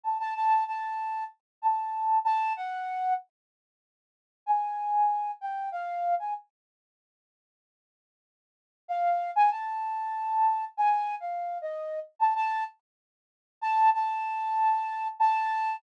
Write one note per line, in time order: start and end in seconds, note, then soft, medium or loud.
0.03 0.18 A5 medium
0.20 0.34 A5 medium
0.36 0.64 A5 medium
0.67 1.24 A5 medium
1.62 2.19 A5 medium
2.25 2.53 A5 loud
2.57 3.13 F#5 medium
4.46 5.31 G#5 medium
5.41 5.69 G5 medium
5.72 6.14 F5 medium
6.19 6.34 G#5 medium
8.88 9.31 F5 medium
9.36 9.50 G#5 loud
9.51 10.65 A5 medium
10.77 11.15 G#5 medium
11.20 11.58 F5 medium
11.62 11.99 D#5 medium
12.19 12.34 A5 medium
12.36 12.64 A5 loud
13.61 13.90 A5 loud
13.94 15.08 A5 medium
15.19 15.76 A5 loud